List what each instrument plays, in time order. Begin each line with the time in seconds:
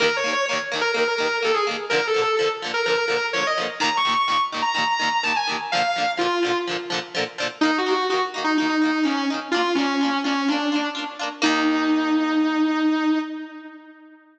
0.00 overdriven guitar D#2 D#3 A#3, distortion guitar A#4
0.16 distortion guitar C#5
0.24 overdriven guitar D#2 D#3 A#3
0.33 distortion guitar C#5
0.46 overdriven guitar A#3, distortion guitar C#5
0.51 overdriven guitar D#2 D#3
0.72 overdriven guitar D#2 D#3 A#3
0.81 distortion guitar A#4
0.94 overdriven guitar D#2 D#3 A#3, distortion guitar A#4
1.07 distortion guitar A#4
1.18 overdriven guitar D#2 D#3 A#3
1.42 overdriven guitar D#2 D#3 A#3, distortion guitar A4
1.54 distortion guitar G#4
1.67 overdriven guitar D#2 D#3 A#3
1.90 overdriven guitar D3 F3, distortion guitar A#4
1.95 overdriven guitar A#2
2.07 distortion guitar A4
2.14 overdriven guitar A#2 D3 F3
2.22 distortion guitar A4
2.37 overdriven guitar F3, distortion guitar A4
2.41 overdriven guitar A#2 D3
2.62 overdriven guitar A#2 D3 F3
2.74 distortion guitar A#4
2.86 overdriven guitar D3 F3, distortion guitar A#4
2.90 overdriven guitar A#2
2.97 distortion guitar A#4
3.08 overdriven guitar A#2 D3 F3
3.33 overdriven guitar D3 F3, distortion guitar C#5
3.38 overdriven guitar A#2
3.47 distortion guitar D#5
3.58 overdriven guitar A#2 D3 F3
3.80 overdriven guitar D#2 A#2 D#3, distortion guitar A#5
3.97 distortion guitar C#6
4.05 overdriven guitar D#2 A#2 D#3
4.12 distortion guitar C#6
4.28 overdriven guitar D#2 A#2 D#3, distortion guitar C#6
4.52 overdriven guitar D#2 A#2 D#3
4.62 distortion guitar A#5
4.74 overdriven guitar D#2 A#2 D#3, distortion guitar A#5
4.87 distortion guitar A#5
5.00 overdriven guitar D#2 A#2 D#3
5.23 overdriven guitar D#2 A#2 D#3, distortion guitar A5
5.36 distortion guitar G#5
5.47 overdriven guitar D#2 A#2 D#3
5.72 overdriven guitar D3 F3, distortion guitar F5
5.77 overdriven guitar A#2
5.96 overdriven guitar A#2 D3 F3
6.17 overdriven guitar A#2 D3 F3, distortion guitar F4
6.43 overdriven guitar A#2 D3 F3
6.67 overdriven guitar A#2 D3 F3
6.90 overdriven guitar A#2 D3 F3
7.15 overdriven guitar A#2 D3 F3
7.38 overdriven guitar A#2 D3 F3
7.61 overdriven guitar A#3 D#4, distortion guitar D#4
7.65 overdriven guitar D#3
7.78 distortion guitar F#4
7.86 overdriven guitar D#3 A#3 D#4
7.92 distortion guitar F#4
8.10 overdriven guitar A#3 D#4, distortion guitar F#4
8.14 overdriven guitar D#3
8.34 overdriven guitar D#3 A#3 D#4
8.44 distortion guitar D#4
8.58 overdriven guitar A#3 D#4, distortion guitar D#4
8.62 overdriven guitar D#3
8.69 distortion guitar D#4
8.82 overdriven guitar D#3 A#3 D#4
9.03 overdriven guitar D#3 A#3 D#4, distortion guitar C#4
9.17 distortion guitar C#4
9.30 overdriven guitar D#3 A#3 D#4
9.51 overdriven guitar D4 F4, distortion guitar F4
9.56 overdriven guitar A#3
9.75 distortion guitar C#4, overdriven guitar D4 F4
9.80 overdriven guitar A#3
10.01 overdriven guitar A#3 D4 F4
10.24 overdriven guitar A#3 D4 F4, distortion guitar C#4
10.48 overdriven guitar A#3 D4 F4, distortion guitar D4
10.72 overdriven guitar A#3 D4 F4
10.95 overdriven guitar A#3 D4 F4
11.19 overdriven guitar A#3 D4 F4
11.42 overdriven guitar D#2 D#3 A#3, distortion guitar D#4